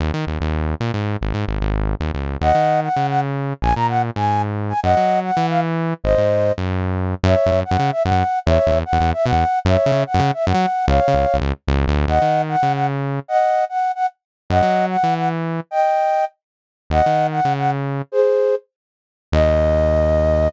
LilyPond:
<<
  \new Staff \with { instrumentName = "Flute" } { \time 9/8 \key ees \dorian \tempo 4. = 149 r1 r8 | r1 r8 | <ees'' ges''>4. ges''4 ges''8 r4. | aes''8 bes''8 ges''8 r8 aes''4 r4 aes''8 |
<ees'' ges''>4. ges''4 f''8 r4. | <c'' ees''>2 r2 r8 | \key fis \dorian <cis'' e''>4. fis''4 e''8 fis''4. | <cis'' e''>4. fis''4 e''8 fis''4. |
<cis'' e''>4. fis''4 e''8 fis''4. | <cis'' eis''>2 r2 r8 | \key ees \dorian <ees'' ges''>4. ges''4 ges''8 r4. | <ees'' ges''>4. ges''4 ges''8 r4. |
<ees'' ges''>4. ges''4 ges''8 r4. | <ees'' g''>2~ <ees'' g''>8 r2 | <ees'' ges''>4. ges''4 ges''8 r4. | <aes' c''>2 r2 r8 |
ees''1~ ees''8 | }
  \new Staff \with { instrumentName = "Synth Bass 1" } { \clef bass \time 9/8 \key ees \dorian ees,8 ees8 ees,8 ees,4. bes,8 aes,4 | aes,,8 aes,8 aes,,8 aes,,4. ees,8 des,4 | ees,8 ees4. des2~ des8 | bes,,8 bes,4. aes,2~ aes,8 |
ges,8 ges4. e2~ e8 | aes,,8 aes,4. ges,2~ ges,8 | \key fis \dorian fis,8. fis,16 fis,8. fis,16 cis4 fis,16 fis,4~ fis,16 | e,8. e,16 e,8. e,16 e,4 b,16 e,4~ e,16 |
fis,8. cis16 cis8. fis,16 cis4 fis,16 fis4~ fis16 | cis,8. cis16 cis,8. cis,16 cis,4 cis,8. d,8. | \key ees \dorian ees,8 ees4. des2~ des8 | r1 r8 |
ges,8 ges4. e2~ e8 | r1 r8 | ees,8 ees4. des2~ des8 | r1 r8 |
ees,1~ ees,8 | }
>>